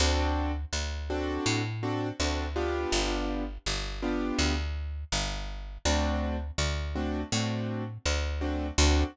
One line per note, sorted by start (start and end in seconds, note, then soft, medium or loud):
0.00 0.65 D2 medium
0.00 0.52 C4 loud
0.00 0.52 D4 loud
0.00 0.52 F#4 loud
0.00 0.52 A4 loud
0.73 1.38 D2 medium
1.10 1.61 C4 loud
1.10 1.61 D4 loud
1.10 1.61 F#4 loud
1.10 1.61 A4 medium
1.46 2.12 A2 medium
1.83 2.09 C4 loud
1.83 2.09 D4 medium
1.83 2.09 F#4 loud
1.83 2.09 A4 medium
2.20 2.86 D2 medium
2.20 2.46 C4 medium
2.20 2.46 D4 medium
2.20 2.46 F#4 medium
2.20 2.46 A4 medium
2.56 3.44 B3 loud
2.56 3.44 D4 loud
2.56 3.44 F4 loud
2.56 3.44 G4 loud
2.92 3.58 G1 medium
3.66 4.32 G1 medium
4.02 4.54 B3 loud
4.02 4.54 D4 medium
4.02 4.54 F4 loud
4.02 4.54 G4 medium
4.39 5.04 D2 medium
5.12 5.78 G1 medium
5.85 6.51 D2 medium
5.85 6.36 A3 medium
5.85 6.36 C4 loud
5.85 6.36 D4 loud
5.85 6.36 F#4 loud
6.58 7.24 D2 medium
6.95 7.21 A3 medium
6.95 7.21 C4 medium
6.95 7.21 D4 medium
6.95 7.21 F#4 medium
7.32 7.98 A2 medium
7.32 7.83 A3 medium
7.32 7.83 C4 medium
7.32 7.83 D4 medium
7.32 7.83 F#4 medium
8.05 8.71 D2 medium
8.41 8.67 A3 loud
8.41 8.67 C4 medium
8.41 8.67 D4 medium
8.41 8.67 F#4 medium
8.78 9.04 D2 loud
8.78 9.04 C4 medium
8.78 9.04 D4 loud
8.78 9.04 F#4 loud
8.78 9.04 A4 medium